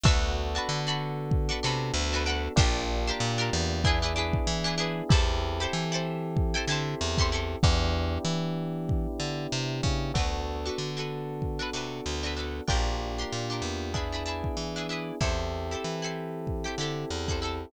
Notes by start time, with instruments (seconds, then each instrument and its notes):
0.03 electric bass (finger) D2, electric piano 1 B3 D4 F#4 A4, pizzicato strings D4 F#4 A4, kick
0.08 pizzicato strings B4
0.55 pizzicato strings D4 F#4 A4 B4
0.69 electric bass (finger) D3
0.87 pizzicato strings D4 F#4 A4 B4
1.31 kick
1.49 pizzicato strings D4 F#4 A4 B4
1.63 electric bass (finger) C3, pizzicato strings D4 F#4 A4 B4
1.94 electric bass (finger) D2
2.13 pizzicato strings D4 F#4 A4 B4
2.26 pizzicato strings D4 F#4 A4 B4
2.56 electric bass (finger) A#1, electric piano 1 A#3 D4 F4 G4, pizzicato strings D4 F4 G4, kick
2.61 pizzicato strings A#4
3.07 pizzicato strings D4 F4 G4 A#4
3.20 electric bass (finger) A#2
3.38 pizzicato strings D4 F4 G4 A#4
3.53 electric bass (finger) E2
3.84 electric piano 1 B3 D4 E4 G#4, pizzicato strings D4 E4 G#4 B4, kick
4.02 pizzicato strings D4 E4 G#4 B4
4.16 pizzicato strings D4 E4 G#4 B4
4.33 kick
4.47 electric bass (finger) E3
4.64 pizzicato strings D4 E4 G#4 B4
4.78 pizzicato strings D4 E4 G#4 B4
5.09 electric bass (finger) E2, electric piano 1 C4 E4 G4 A4, pizzicato strings E4 G4 A4, kick
5.14 pizzicato strings C5
5.60 pizzicato strings E4 G4 A4 C5
5.73 electric bass (finger) E3
5.92 pizzicato strings E4 G4 A4 C5
6.37 kick
6.54 pizzicato strings E4 G4 A4 C5
6.68 electric bass (finger) D3, pizzicato strings E4 G4 A4
6.72 pizzicato strings C5
7.01 electric bass (finger) E2
7.18 pizzicato strings E4 G4 A4, kick
7.22 pizzicato strings C5
7.32 pizzicato strings E4 G4 A4 C5
7.63 electric bass (finger) E2, electric piano 1 B3 D4 E4 G4, kick
8.25 electric bass (finger) E3
8.89 kick
9.20 electric bass (finger) D3
9.52 electric bass (finger) C3
9.83 electric bass (finger) C#3, kick
10.14 electric bass (finger) D2, electric piano 1 B3 D4 F#4 A4, pizzicato strings D4 F#4 A4, kick
10.18 pizzicato strings B4
10.65 pizzicato strings D4 F#4 A4 B4
10.78 electric bass (finger) D3
10.97 pizzicato strings D4 F#4 A4 B4
11.42 kick
11.59 pizzicato strings D4 F#4 A4 B4
11.73 electric bass (finger) C3, pizzicato strings D4 F#4 A4 B4
12.06 electric bass (finger) D2
12.23 pizzicato strings D4 F#4 A4 B4
12.36 pizzicato strings D4 F#4 A4 B4
12.68 electric bass (finger) A#1, electric piano 1 A#3 D4 F4 G4, pizzicato strings D4 F4 G4 A#4, kick
13.18 pizzicato strings D4 F4 G4 A#4
13.32 electric bass (finger) A#2
13.50 pizzicato strings D4 F4 G4 A#4
13.62 electric bass (finger) E2
13.94 electric piano 1 B3 D4 E4 G#4, pizzicato strings D4 E4 G#4 B4, kick
14.12 pizzicato strings D4 E4 G#4 B4
14.26 pizzicato strings D4 E4 G#4 B4
14.44 kick
14.57 electric bass (finger) E3
14.76 pizzicato strings D4 E4 G#4 B4
14.89 pizzicato strings D4 E4 G#4 B4
15.21 electric bass (finger) E2, electric piano 1 C4 E4 G4 A4, pizzicato strings E4 G4 A4 C5, kick
15.71 pizzicato strings E4 G4 A4 C5
15.84 electric bass (finger) E3
16.02 pizzicato strings E4 G4 A4 C5
16.47 kick
16.64 pizzicato strings E4 G4 A4 C5
16.78 electric bass (finger) D3, pizzicato strings E4 G4 A4
16.83 pizzicato strings C5
17.10 electric bass (finger) E2
17.28 pizzicato strings E4 G4 A4 C5, kick
17.42 pizzicato strings E4 G4 A4 C5